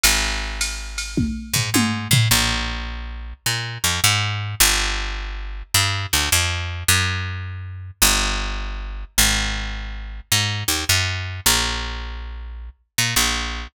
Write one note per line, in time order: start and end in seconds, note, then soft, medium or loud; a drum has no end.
0.03 1.28 G#1 medium
0.03 ride medium
0.61 hi-hat pedal medium
0.61 ride medium
0.98 ride medium
1.17 kick medium
1.17 high tom medium
1.53 1.70 G#2 medium
1.53 floor tom medium
1.74 2.08 G#2 medium
1.74 high tom medium
2.11 2.28 A2 medium
2.11 floor tom medium
2.31 3.33 A#1 medium
3.46 3.78 A#2 medium
3.84 4.00 F2 medium
4.04 4.55 G#2 medium
4.60 5.63 G1 loud
5.74 6.06 G2 medium
6.13 6.30 D2 medium
6.32 6.84 F2 medium
6.88 7.91 F#2 medium
8.02 9.04 G1 loud
9.18 10.20 G#1 medium
10.32 10.64 G#2 medium
10.68 10.85 D#2 medium
10.89 11.40 F#2 medium
11.46 12.70 A#1 medium
12.98 13.15 A#2 medium
13.16 13.68 A#1 medium